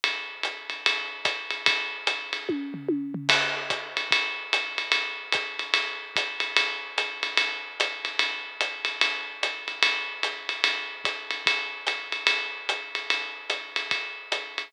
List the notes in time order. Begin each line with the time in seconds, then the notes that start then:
0.04 ride
0.43 hi-hat pedal, ride
0.70 ride
0.86 ride
1.25 kick, hi-hat pedal, ride
1.51 ride
1.66 kick, ride
2.07 hi-hat pedal, ride
2.33 ride
2.49 kick, high tom
2.74 floor tom
2.89 high tom
3.14 floor tom
3.29 kick, crash, ride
3.70 kick, hi-hat pedal, ride
3.97 ride
4.11 kick, ride
4.53 hi-hat pedal, ride
4.78 ride
4.92 ride
5.32 kick, hi-hat pedal, ride
5.59 ride
5.74 ride
6.16 kick, hi-hat pedal, ride
6.40 ride
6.57 ride
6.98 hi-hat pedal, ride
7.23 ride
7.37 ride
7.80 hi-hat pedal, ride
8.05 ride
8.19 ride
8.61 hi-hat pedal, ride
8.85 ride
9.01 ride
9.43 hi-hat pedal, ride
9.68 ride
9.83 ride
10.23 hi-hat pedal, ride
10.49 ride
10.64 ride
11.05 kick, hi-hat pedal, ride
11.31 ride
11.46 kick, ride
11.87 hi-hat pedal, ride
12.12 ride
12.27 ride
12.69 hi-hat pedal, ride
12.95 ride
13.10 ride
13.50 hi-hat pedal, ride
13.76 ride
13.91 kick, ride
14.32 hi-hat pedal, ride
14.58 ride